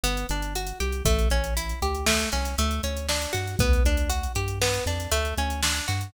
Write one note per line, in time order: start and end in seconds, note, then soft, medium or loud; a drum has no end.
0.03 0.25 G1 medium
0.03 0.27 B3 loud
0.03 closed hi-hat loud
0.17 closed hi-hat medium
0.29 0.73 G1 medium
0.29 0.53 D4 medium
0.29 closed hi-hat medium
0.42 closed hi-hat medium
0.55 0.78 F#4 medium
0.55 closed hi-hat medium
0.67 closed hi-hat medium
0.80 1.02 C2 medium
0.80 1.03 G4 loud
0.80 closed hi-hat medium
0.92 closed hi-hat medium
1.05 1.27 A1 medium
1.05 1.28 A3 loud
1.05 kick medium
1.05 closed hi-hat loud
1.19 closed hi-hat medium
1.30 1.74 A1 medium
1.30 1.54 C#4 medium
1.30 closed hi-hat medium
1.44 closed hi-hat medium
1.57 1.80 E4 medium
1.57 closed hi-hat loud
1.69 closed hi-hat medium
1.82 2.25 D2 medium
1.82 2.05 G4 medium
1.82 closed hi-hat medium
1.95 closed hi-hat medium
2.06 2.29 A3 loud
2.06 snare loud
2.20 closed hi-hat medium
2.32 2.55 C2 medium
2.32 2.56 C#4 medium
2.32 closed hi-hat medium
2.45 closed hi-hat medium
2.58 2.80 D2 medium
2.58 2.81 A3 loud
2.58 closed hi-hat medium
2.71 closed hi-hat medium
2.83 3.27 D2 medium
2.83 3.07 C#4 medium
2.83 closed hi-hat medium
2.97 closed hi-hat medium
3.09 3.32 D4 loud
3.09 snare loud
3.22 closed hi-hat medium
3.33 3.56 G2 medium
3.33 3.56 F#4 medium
3.33 closed hi-hat medium
3.47 closed hi-hat medium
3.59 3.81 D2 medium
3.59 3.83 B3 loud
3.59 kick loud
3.59 closed hi-hat medium
3.73 closed hi-hat medium
3.84 4.28 D2 medium
3.84 4.09 D4 loud
3.84 closed hi-hat medium
3.97 closed hi-hat medium
4.10 4.32 F#4 medium
4.10 closed hi-hat loud
4.23 closed hi-hat medium
4.35 4.79 G2 medium
4.35 4.59 G4 medium
4.35 closed hi-hat medium
4.48 closed hi-hat medium
4.62 4.84 B3 loud
4.62 snare loud
4.74 closed hi-hat medium
4.86 5.08 F2 medium
4.86 5.10 D4 medium
4.86 closed hi-hat medium
5.00 closed hi-hat medium
5.11 5.33 D2 medium
5.11 5.35 A3 loud
5.11 closed hi-hat loud
5.25 closed hi-hat medium
5.38 5.81 D2 medium
5.38 5.61 C#4 medium
5.38 closed hi-hat medium
5.50 closed hi-hat medium
5.63 5.86 D4 loud
5.63 snare loud
5.76 closed hi-hat medium
5.88 6.10 G2 medium
5.88 6.11 F#4 medium
5.88 closed hi-hat medium
6.01 closed hi-hat medium